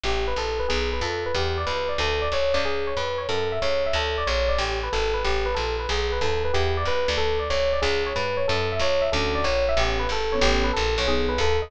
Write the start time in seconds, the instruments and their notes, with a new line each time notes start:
0.04 electric bass (finger) A1, electric piano 1 G4
0.27 electric piano 1 B4
0.36 electric bass (finger) A#1, electric piano 1 A4
0.59 electric piano 1 B4
0.68 electric bass (finger) B1, electric piano 1 G#4
0.93 electric piano 1 B4
1.01 electric bass (finger) F2, electric piano 1 A4
1.26 electric piano 1 B4
1.35 electric bass (finger) E2, electric piano 1 G4
1.57 electric piano 1 D5
1.66 electric bass (finger) C#2, electric piano 1 B4
1.89 electric piano 1 D5
1.98 electric bass (finger) D2, electric piano 1 A4
2.22 electric piano 1 D5
2.32 electric bass (finger) C2, electric piano 1 C#5
2.53 electric bass (finger) C#2, electric piano 1 D5
2.65 electric piano 1 G#4
2.87 electric piano 1 C#5
2.97 electric bass (finger) F2, electric piano 1 B4
3.18 electric piano 1 C#5
3.29 electric bass (finger) F#2, electric piano 1 A4
3.52 electric piano 1 E5
3.62 electric bass (finger) C#2, electric piano 1 C#5
3.86 electric piano 1 E5
3.93 electric bass (finger) D2, electric piano 1 A4
4.18 electric piano 1 D5
4.27 electric bass (finger) A#1, electric piano 1 C#5
4.49 electric piano 1 D5
4.58 electric bass (finger) A1, electric piano 1 G4
4.83 electric piano 1 B4
4.93 electric bass (finger) G#1, electric piano 1 A4
5.14 electric piano 1 B4
5.24 electric bass (finger) A1, electric piano 1 G4
5.46 electric piano 1 B4
5.55 electric bass (finger) A#1, electric piano 1 A4
5.79 electric piano 1 B4
5.89 electric bass (finger) B1, electric piano 1 G#4
6.12 electric piano 1 B4
6.21 electric bass (finger) D#2, electric piano 1 A4
6.44 electric piano 1 B4
6.53 electric bass (finger) E2, electric piano 1 G4
6.77 electric piano 1 D5
6.85 electric bass (finger) C#2, electric piano 1 B4
7.08 electric bass (finger) D2, electric piano 1 D5
7.17 electric piano 1 A4
7.39 electric piano 1 D5
7.50 electric bass (finger) C2, electric piano 1 C#5
7.73 electric piano 1 D5
7.82 electric bass (finger) C#2, electric piano 1 G#4
8.06 electric piano 1 C#5
8.16 electric bass (finger) G2, electric piano 1 B4
8.37 electric piano 1 C#5
8.48 electric bass (finger) F#2, electric piano 1 A4
8.72 electric piano 1 E5
8.79 electric bass (finger) C#2, electric piano 1 C#5
9.02 electric piano 1 E5
9.12 electric bass (finger) D2, acoustic grand piano C#4 D4 E4 F#4, electric piano 1 A4
9.35 electric piano 1 D5
9.44 electric bass (finger) A#1, electric piano 1 C#5
9.69 electric piano 1 E5
9.77 electric bass (finger) A1, acoustic grand piano B3 C#4 G4 A4, electric piano 1 G4
9.99 electric piano 1 B4
10.09 electric bass (finger) G#1, electric piano 1 A4
10.32 acoustic grand piano B3 C#4 G4 A4, electric piano 1 C#5
10.41 electric bass (finger) A1, electric piano 1 G4
10.64 electric piano 1 B4
10.73 electric bass (finger) A#1, electric piano 1 A4
10.98 electric bass (finger) B1, electric piano 1 C#5
11.07 acoustic grand piano B3 D#4 G#4 A4, electric piano 1 G#4
11.29 electric piano 1 B4
11.38 electric bass (finger) D#2, electric piano 1 A4
11.62 electric piano 1 D#5